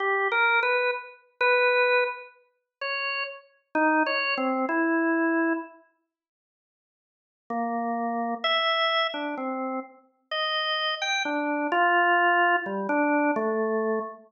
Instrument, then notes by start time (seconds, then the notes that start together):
drawbar organ
0.00 G4
0.32 A#4
0.63 B4
1.41 B4
2.81 C#5
3.75 D#4
4.06 C#5
4.38 C4
4.69 E4
7.50 A#3
8.44 E5
9.14 D4
9.38 C4
10.31 D#5
11.02 G5
11.25 D4
11.72 F4
12.66 G3
12.89 D4
13.36 A3